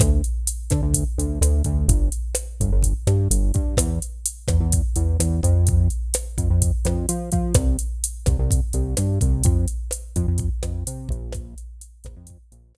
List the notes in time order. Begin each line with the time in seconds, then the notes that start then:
0.00 D2, kick, cross-stick, closed hi-hat
0.24 closed hi-hat
0.47 closed hi-hat
0.70 D3, kick, cross-stick, closed hi-hat
0.83 D2
0.94 kick, closed hi-hat
1.18 D2, closed hi-hat
1.41 D2, cross-stick, closed hi-hat
1.64 D2, kick, closed hi-hat
1.88 G1, kick, closed hi-hat
2.12 closed hi-hat
2.35 cross-stick, closed hi-hat
2.60 G1, kick, closed hi-hat
2.72 G1
2.82 kick, closed hi-hat
3.07 G2, cross-stick, closed hi-hat
3.31 G1, closed hi-hat
3.54 G2, kick, closed hi-hat
3.77 E2, kick, cross-stick, closed hi-hat
4.02 closed hi-hat
4.26 closed hi-hat
4.48 E2, kick, cross-stick, closed hi-hat
4.60 E2
4.72 kick, closed hi-hat
4.96 E2, closed hi-hat
5.20 E2, cross-stick, closed hi-hat
5.43 F2, kick, closed hi-hat
5.67 kick, closed hi-hat
5.90 closed hi-hat
6.14 cross-stick, closed hi-hat
6.38 F2, kick, closed hi-hat
6.50 F2
6.62 kick, closed hi-hat
6.85 F2, cross-stick, closed hi-hat
7.09 F3, closed hi-hat
7.32 F3, kick, closed hi-hat
7.54 C2, kick, cross-stick, closed hi-hat
7.79 closed hi-hat
8.04 closed hi-hat
8.26 C2, kick, cross-stick, closed hi-hat
8.39 C2
8.51 kick, closed hi-hat
8.73 C2, closed hi-hat
8.97 G2, cross-stick, closed hi-hat
9.21 C2, kick, closed hi-hat
9.44 F2, kick, closed hi-hat
9.68 closed hi-hat
9.91 cross-stick, closed hi-hat
10.16 F2, kick, closed hi-hat
10.28 F2
10.38 kick, closed hi-hat
10.63 F2, cross-stick, closed hi-hat
10.87 C3, closed hi-hat
11.09 A#1, kick, closed hi-hat
11.32 kick, cross-stick, closed hi-hat
11.58 closed hi-hat
11.81 closed hi-hat
12.04 A#1, kick, cross-stick, closed hi-hat
12.16 F2
12.27 kick, closed hi-hat
12.52 A#1, closed hi-hat
12.75 A#1, cross-stick, closed hi-hat